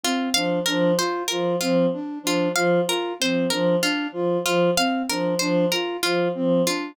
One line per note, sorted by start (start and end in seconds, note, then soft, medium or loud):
0.04 0.29 C4 medium
0.04 0.30 F4 medium
0.34 0.59 F3 medium
0.34 0.60 D4 medium
0.34 0.59 F5 medium
0.66 0.94 F3 medium
0.66 0.92 D4 medium
0.66 0.91 A#4 medium
0.98 1.23 F4 medium
0.98 1.24 C5 medium
1.28 1.56 F3 medium
1.28 1.56 F4 medium
1.28 1.53 A#4 medium
1.61 1.86 F3 medium
1.61 1.86 C4 medium
1.61 1.86 F4 medium
1.93 2.19 D4 medium
2.23 2.48 F3 medium
2.23 2.49 D4 medium
2.23 2.52 F4 medium
2.54 2.80 F3 medium
2.54 2.81 F4 medium
2.54 2.81 F5 medium
2.88 3.13 F4 medium
2.88 3.14 A#4 medium
3.20 3.46 F3 medium
3.20 3.45 C4 medium
3.20 3.47 C5 medium
3.50 3.76 F3 medium
3.50 3.76 D4 medium
3.50 3.76 A#4 medium
3.82 4.07 D4 medium
3.82 4.08 F4 medium
4.12 4.37 F3 medium
4.12 4.39 F4 medium
4.44 4.70 F3 medium
4.44 4.71 F4 medium
4.77 5.02 C4 medium
4.77 5.03 F5 medium
5.09 5.35 F3 medium
5.09 5.34 D4 medium
5.09 5.35 A#4 medium
5.39 5.65 F3 medium
5.39 5.66 D4 medium
5.39 5.64 C5 medium
5.72 5.97 F4 medium
5.72 5.97 A#4 medium
6.03 6.29 F3 medium
6.03 6.28 F4 medium
6.03 6.29 F4 medium
6.35 6.62 F3 medium
6.35 6.60 C4 medium
6.67 6.92 D4 medium
6.67 6.92 F4 medium